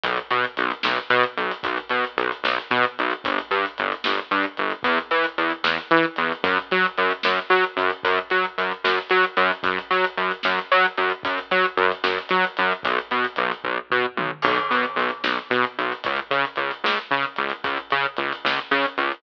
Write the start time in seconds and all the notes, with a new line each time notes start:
0.04 B1, kick, closed hi-hat
0.17 closed hi-hat
0.31 B2, closed hi-hat
0.44 closed hi-hat
0.57 B1, closed hi-hat
0.71 closed hi-hat
0.83 B1, snare
0.97 closed hi-hat
1.10 B2, closed hi-hat
1.23 closed hi-hat
1.37 B1, closed hi-hat
1.51 closed hi-hat
1.63 B1, kick, closed hi-hat
1.77 closed hi-hat
1.89 B2, closed hi-hat
2.04 closed hi-hat
2.17 B1, closed hi-hat
2.32 closed hi-hat
2.44 B1, snare
2.60 closed hi-hat
2.71 B2, closed hi-hat
2.83 closed hi-hat
2.99 B1, closed hi-hat
3.11 closed hi-hat
3.24 G1, kick, closed hi-hat
3.38 closed hi-hat
3.51 G2, closed hi-hat
3.66 closed hi-hat
3.78 G1, closed hi-hat
3.92 closed hi-hat
4.04 G1, snare
4.18 closed hi-hat
4.31 G2, closed hi-hat
4.43 closed hi-hat
4.57 G1, closed hi-hat
4.70 closed hi-hat
4.83 E2, kick, closed hi-hat
4.98 closed hi-hat
5.11 E3, closed hi-hat
5.24 closed hi-hat
5.38 E2, closed hi-hat
5.50 closed hi-hat
5.64 E2, snare
5.79 closed hi-hat
5.91 E3, closed hi-hat
6.03 closed hi-hat
6.16 E2, closed hi-hat
6.32 closed hi-hat
6.44 F#2, kick, closed hi-hat
6.59 closed hi-hat
6.71 F#3, closed hi-hat
6.85 closed hi-hat
6.98 F#2, closed hi-hat
7.11 closed hi-hat
7.23 F#2, snare
7.39 closed hi-hat
7.50 F#3, closed hi-hat
7.64 closed hi-hat
7.77 F#2, closed hi-hat
7.90 closed hi-hat
8.03 F#2, kick, closed hi-hat
8.18 closed hi-hat
8.30 F#3, closed hi-hat
8.44 closed hi-hat
8.58 F#2, closed hi-hat
8.71 closed hi-hat
8.84 F#2, snare
8.98 closed hi-hat
9.10 F#3, closed hi-hat
9.24 closed hi-hat
9.37 F#2, closed hi-hat
9.52 closed hi-hat
9.63 F#2, kick, closed hi-hat
9.79 closed hi-hat
9.91 F#3, closed hi-hat
10.04 closed hi-hat
10.17 F#2, closed hi-hat
10.31 closed hi-hat
10.43 F#2, snare
10.59 closed hi-hat
10.72 F#3, closed hi-hat
10.85 closed hi-hat
10.98 F#2, closed hi-hat
11.10 closed hi-hat
11.23 F#2, kick, closed hi-hat
11.38 closed hi-hat
11.51 F#3, closed hi-hat
11.64 closed hi-hat
11.77 F#2, closed hi-hat
11.92 closed hi-hat
12.04 F#2, snare
12.19 closed hi-hat
12.29 F#3, closed hi-hat
12.44 closed hi-hat
12.57 F#2, closed hi-hat
12.72 closed hi-hat
12.83 B1, kick, closed hi-hat
12.99 closed hi-hat
13.11 B2, closed hi-hat
13.25 closed hi-hat
13.36 B1, closed hi-hat
13.52 closed hi-hat
13.64 B1, kick
13.90 B2, floor tom
14.17 B1, mid tom
14.42 B1, kick, crash
14.57 closed hi-hat
14.71 B2, closed hi-hat
14.83 closed hi-hat
14.96 B1, closed hi-hat
15.09 closed hi-hat
15.24 B1, snare
15.36 closed hi-hat
15.50 B2, closed hi-hat
15.64 closed hi-hat
15.78 B1, closed hi-hat
15.92 closed hi-hat
16.04 C#2, kick, closed hi-hat
16.16 closed hi-hat
16.31 C#3, closed hi-hat
16.45 closed hi-hat
16.56 C#2, closed hi-hat
16.71 closed hi-hat
16.84 C#2, snare
16.97 closed hi-hat
17.11 C#3, closed hi-hat
17.23 closed hi-hat
17.36 C#2, closed hi-hat
17.50 closed hi-hat
17.64 C#2, kick, closed hi-hat
17.77 closed hi-hat
17.91 C#3, closed hi-hat
18.04 closed hi-hat
18.17 C#2, closed hi-hat
18.33 closed hi-hat
18.45 C#2, snare
18.57 closed hi-hat
18.71 C#3, closed hi-hat
18.85 closed hi-hat
18.98 C#2, closed hi-hat
19.12 closed hi-hat